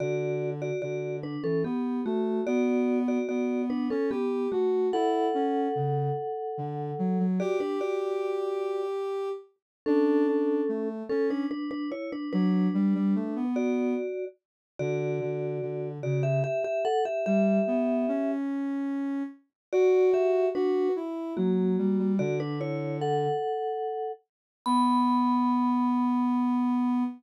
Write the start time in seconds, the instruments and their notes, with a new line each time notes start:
0.00 ocarina D3, vibraphone F#4 D5
0.62 vibraphone F#4 D5
0.82 ocarina D3, vibraphone F#4 D5
1.23 vibraphone D4 B4
1.44 ocarina E3, vibraphone C#4 A4
1.64 ocarina B3, vibraphone B3 G4
2.05 ocarina A3, vibraphone A3 F#4
2.47 ocarina B3, vibraphone F#4 D5
3.08 vibraphone F#4 D5
3.29 ocarina B3, vibraphone F#4 D5
3.70 vibraphone D4 B4
3.90 ocarina C#4, vibraphone C#4 A4
4.11 vibraphone B3 G4, ocarina G4
4.52 vibraphone A3 F#4, ocarina F#4
4.93 ocarina E4, vibraphone A4 F#5
5.34 ocarina C#4
5.75 ocarina C#3
6.58 ocarina D3
6.99 ocarina F#3
7.19 ocarina F#3
7.40 vibraphone F#4 D5, ocarina G4
7.60 vibraphone D4 B4
7.81 vibraphone F#4 D5
9.86 vibraphone C#4 A4, ocarina D4
10.27 ocarina D4
10.68 ocarina A3
11.09 vibraphone C#4 A4, ocarina C#4
11.30 vibraphone D4 B4
11.51 vibraphone D4 B4
11.71 vibraphone D4 B4
11.92 vibraphone E4 C#5
12.12 vibraphone D4 B4
12.33 ocarina F#3, vibraphone D4 B4
12.74 ocarina G3
12.95 ocarina G3
13.15 ocarina A3
13.36 ocarina B3
13.56 vibraphone F#4 D5
14.79 ocarina D3, vibraphone F#4 D5
15.21 ocarina D3
15.62 ocarina D3
16.03 ocarina C#3, vibraphone F#4 D5
16.23 vibraphone G4 E5
16.44 vibraphone G4 E5
16.64 vibraphone G4 E5
16.85 vibraphone A4 F#5
17.05 vibraphone G4 E5
17.26 ocarina G3, vibraphone G4 E5
17.67 ocarina B3
18.08 ocarina C#4
19.73 vibraphone F#4 D5, ocarina F#4
20.14 vibraphone G4 E5
20.55 vibraphone D4 B4, ocarina F#4
20.96 ocarina E4
21.37 ocarina F#3, vibraphone A#3 F#4
21.78 ocarina G3
21.99 ocarina G3
22.19 ocarina D3, vibraphone F#4 D5
22.40 vibraphone D4 B4
22.61 vibraphone E4 C#5
23.01 vibraphone A4 F#5
24.66 ocarina B3, vibraphone B5